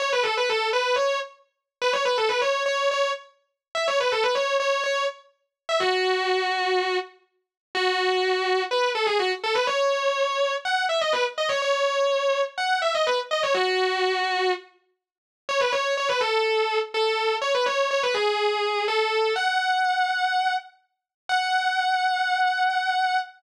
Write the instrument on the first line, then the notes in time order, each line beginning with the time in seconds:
distortion guitar
0.00 C#5
0.13 B4
0.23 A4
0.37 B4
0.49 A4
0.73 B4
0.96 C#5
1.82 B4
1.93 C#5
2.05 B4
2.18 A4
2.29 B4
2.41 C#5
2.66 C#5
2.91 C#5
3.75 E5
3.88 C#5
4.00 B4
4.12 A4
4.23 B4
4.35 C#5
4.60 C#5
4.84 C#5
5.69 E5
5.80 F#4
7.75 F#4
8.71 B4
8.95 A4
9.06 G#4
9.19 F#4
9.44 A4
9.55 B4
9.67 C#5
10.65 F#5
10.89 E5
11.01 D#5
11.13 B4
11.38 D#5
11.49 C#5
11.62 C#5
12.58 F#5
12.82 E5
12.95 D#5
13.07 B4
13.31 D#5
13.43 C#5
13.54 F#4
15.49 C#5
15.60 B4
15.72 C#5
15.97 C#5
16.09 B4
16.21 A4
16.94 A4
17.42 C#5
17.55 B4
17.66 C#5
17.91 C#5
18.03 B4
18.14 G#4
18.88 A4
19.36 F#5
21.29 F#5